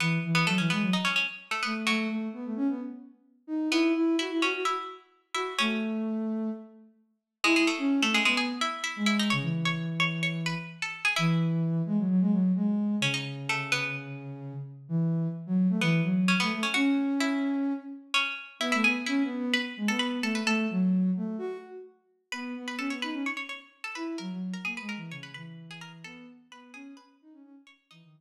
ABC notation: X:1
M:4/4
L:1/16
Q:1/4=129
K:E
V:1 name="Harpsichord"
[B,B]3 [B,B] [A,A] [Cc] [B,B]2 [Dd] [Cc] [Cc] z2 [A,A] [B,B] z | [F,F]6 z10 | [B,B]2 z2 [Ee]2 [Cc]2 [Ee]2 z4 [Ee]2 | [Cc]8 z8 |
[G,G] [G,G] [A,A]3 [A,A] [G,G] [G,G] [Gg]2 [Ee]2 [Ee]2 [Ee] [Dd] | [cc']3 [cc']3 [cc']2 [cc']2 [Bb]3 [Aa]2 [Gg] | [Ee]16 | [Cc] [Dd] z2 [A,A]2 [B,B]6 z4 |
z8 [B,B]4 [Cc] [B,B]2 [Cc] | [Ff]4 [Ee]8 [Cc]4 | [Ee] [Ee] [Gg]2 [Ee]4 [Bb]2 z [Aa] [Bb]2 [Aa] [Bb] | [Aa]10 z6 |
[Bb]3 [Bb] [Aa] [cc'] [Bb]2 [cc'] [cc'] [cc'] z2 [Aa] [Bb] z | [^A^a]3 [Aa] [Gg] [Bb] [Aa]2 [cc'] [Bb] [Bb] z2 [Gg] [Aa] z | [Aa]2 z2 [Bb]2 [Gg]2 [Bb]2 z4 [cc']2 | [Dd]6 z10 |]
V:2 name="Ocarina"
E,2 E,2 F, E, G, F, z6 A,2 | A,2 A,2 B, A, C B, z6 D2 | E2 E2 F E F F z6 F2 | A,8 z8 |
E E z C2 A,2 B,2 z4 G,3 | C, E,11 z4 | E,6 G, F, F, G, F,2 G,4 | C,14 z2 |
E,4 z F,2 A, E,2 F,3 A, A, z | C10 z6 | B, A, B, z (3C2 B,2 B,2 z2 G, B,3 A,2 | A,2 F,4 A,2 F2 z6 |
B,2 B,2 C B, D C z6 E2 | F, F,2 z (3^A,2 G,2 E,2 C,2 E,6 | B,2 z2 B,2 C2 z2 D C C z3 | E, D, E, z13 |]